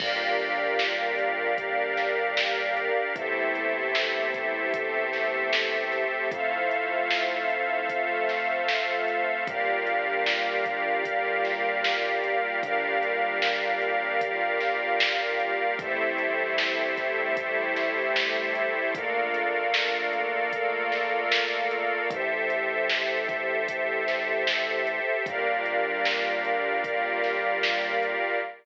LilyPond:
<<
  \new Staff \with { instrumentName = "Pad 5 (bowed)" } { \time 4/4 \key g \dorian \tempo 4 = 76 <bes d' f' g'>2 <bes d' g' bes'>2 | <a c' e' g'>2 <a c' g' a'>2 | <a c' e' f'>2 <a c' f' a'>2 | <g bes d' f'>2 <g bes f' g'>2 |
<g bes d' f'>2 <g bes f' g'>2 | <g a c' e'>2 <g a e' g'>2 | <a bes d' f'>2 <a bes f' a'>2 | r1 |
<g bes d' f'>2 <g bes f' g'>2 | }
  \new Staff \with { instrumentName = "String Ensemble 1" } { \time 4/4 \key g \dorian <g' bes' d'' f''>1 | <g' a' c'' e''>1 | <a' c'' e'' f''>1 | <g' bes' d'' f''>1 |
<g' bes' d'' f''>1 | <g' a' c'' e''>1 | <a' bes' d'' f''>1 | <g' a' c'' e''>1 |
<g' bes' d'' f''>1 | }
  \new Staff \with { instrumentName = "Synth Bass 1" } { \clef bass \time 4/4 \key g \dorian g,,1 | e,1 | f,1 | g,,1 |
g,,1 | a,,1 | bes,,1 | a,,1 |
g,,1 | }
  \new DrumStaff \with { instrumentName = "Drums" } \drummode { \time 4/4 <cymc bd>8 hh8 sn8 hh8 <hh bd>8 <hh sn>8 sn8 hh8 | <hh bd>8 hh8 sn8 <hh bd>8 <hh bd>8 <hh sn>8 sn8 <hh sn>8 | <hh bd>8 hh8 sn8 hh8 <hh bd>8 <hh sn>8 sn8 hh8 | <hh bd>8 hh8 sn8 <hh bd>8 <hh bd>8 <hh sn>8 sn8 hh8 |
<hh bd>8 hh8 sn8 hh8 <hh bd>8 <hh sn>8 sn8 hh8 | <hh bd>8 hh8 sn8 <hh bd sn>8 <hh bd>8 <hh sn>8 sn8 hh8 | <hh bd>8 hh8 sn8 hh8 <hh bd>8 <hh sn>8 sn8 hh8 | <hh bd>8 hh8 sn8 <hh bd>8 <hh bd>8 <hh sn>8 sn8 hh8 |
<hh bd>8 hh8 sn8 hh8 <hh bd>8 <hh sn>8 sn8 hh8 | }
>>